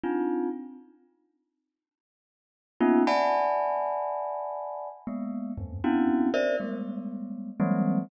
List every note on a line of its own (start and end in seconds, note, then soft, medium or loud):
0.03 0.49 C4 medium
0.03 0.49 D4 medium
0.03 0.49 D#4 medium
0.03 0.49 F4 medium
2.80 3.03 A#3 loud
2.80 3.03 B3 loud
2.80 3.03 C#4 loud
2.80 3.03 D#4 loud
2.80 3.03 F4 loud
3.07 4.89 D5 loud
3.07 4.89 E5 loud
3.07 4.89 F#5 loud
3.07 4.89 G#5 loud
3.07 4.89 A5 loud
3.07 4.89 B5 loud
5.07 5.52 G#3 medium
5.07 5.52 A#3 medium
5.07 5.52 B3 medium
5.58 5.80 E2 medium
5.58 5.80 F#2 medium
5.58 5.80 G2 medium
5.84 6.29 B3 medium
5.84 6.29 C4 medium
5.84 6.29 C#4 medium
5.84 6.29 D4 medium
5.84 6.29 E4 medium
5.84 6.29 F#4 medium
6.34 6.56 A#4 loud
6.34 6.56 C5 loud
6.34 6.56 D5 loud
6.34 6.56 E5 loud
6.60 7.51 G3 medium
6.60 7.51 G#3 medium
6.60 7.51 A3 medium
6.60 7.51 B3 medium
7.60 8.05 E3 loud
7.60 8.05 F#3 loud
7.60 8.05 G3 loud
7.60 8.05 G#3 loud
7.60 8.05 A#3 loud
7.60 8.05 C4 loud